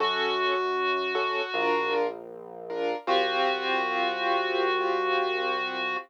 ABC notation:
X:1
M:4/4
L:1/8
Q:1/4=78
K:F#mix
V:1 name="Clarinet"
F6 z2 | F8 |]
V:2 name="Acoustic Grand Piano"
[CF=A]3 [CFA] [=D^E^A]3 [DEA] | [=C=F=G]8 |]
V:3 name="Synth Bass 1" clef=bass
F,,4 A,,,4 | =C,,8 |]